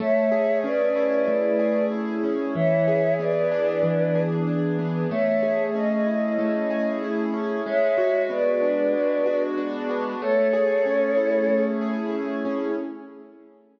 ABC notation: X:1
M:4/4
L:1/8
Q:1/4=94
K:A
V:1 name="Choir Aahs"
[ce]2 [Bd]4 z2 | [ce]2 [Bd]4 z2 | [ce]2 ^d4 z2 | [ce]2 [Bd]4 z2 |
[Ac]5 z3 |]
V:2 name="Acoustic Grand Piano"
A, G C E A, G E C | E, G B, D E, G D B, | A, G C E A, G E C | G, F B, D G, F D B, |
A, G C E A, G E C |]